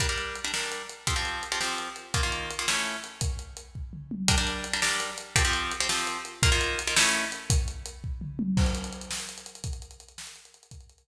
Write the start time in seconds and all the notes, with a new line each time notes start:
0.00 G3 D4 A#4, kick, closed hi-hat
0.09 G3 D4 A#4
0.18 closed hi-hat
0.35 closed hi-hat
0.44 G3 D4 A#4
0.54 G3 D4 A#4, snare
0.72 closed hi-hat
0.89 closed hi-hat
1.07 F3 C4 G4, kick, closed hi-hat
1.16 F3 C4 G4
1.25 closed hi-hat
1.43 closed hi-hat
1.52 F3 C4 G4
1.61 F3 C4 G4, snare
1.78 closed hi-hat
1.96 closed hi-hat
2.14 D#3 A#3 F4, kick, closed hi-hat
2.23 D#3 A#3 F4
2.32 closed hi-hat
2.51 closed hi-hat
2.59 D#3 A#3 F4
2.68 A3 C#4 E4, snare
2.85 closed hi-hat
3.04 closed hi-hat
3.21 kick, closed hi-hat
3.39 closed hi-hat
3.57 closed hi-hat
3.75 kick
3.93 mid tom
4.11 high tom
4.28 G3 D4 A#4, kick, closed hi-hat
4.38 G3 D4 A#4
4.47 closed hi-hat
4.64 closed hi-hat
4.73 G3 D4 A#4
4.82 G3 D4 A#4, snare
5.00 closed hi-hat
5.18 closed hi-hat
5.36 F3 C4 G4, kick, closed hi-hat
5.45 F3 C4 G4
5.53 closed hi-hat
5.72 closed hi-hat
5.80 F3 C4 G4
5.89 F3 C4 G4, snare
6.07 closed hi-hat
6.25 closed hi-hat
6.43 D#3 A#3 F4, kick, closed hi-hat
6.52 D#3 A#3 F4
6.61 closed hi-hat
6.79 closed hi-hat
6.87 D#3 A#3 F4
6.96 A3 C#4 E4, snare
7.14 closed hi-hat
7.32 closed hi-hat
7.50 kick, closed hi-hat
7.68 closed hi-hat
7.86 closed hi-hat
8.04 kick
8.21 mid tom
8.39 high tom
8.57 kick, crash
8.66 closed hi-hat
8.75 closed hi-hat
8.84 closed hi-hat
8.93 closed hi-hat
9.01 closed hi-hat
9.11 snare
9.20 closed hi-hat
9.29 closed hi-hat
9.38 closed hi-hat
9.46 closed hi-hat
9.55 closed hi-hat
9.64 kick, closed hi-hat
9.73 closed hi-hat
9.82 closed hi-hat
9.91 closed hi-hat
10.00 closed hi-hat
10.08 closed hi-hat
10.18 snare
10.27 closed hi-hat
10.36 closed hi-hat
10.45 closed hi-hat
10.54 closed hi-hat
10.63 closed hi-hat
10.71 kick, closed hi-hat
10.81 closed hi-hat
10.90 closed hi-hat
10.98 closed hi-hat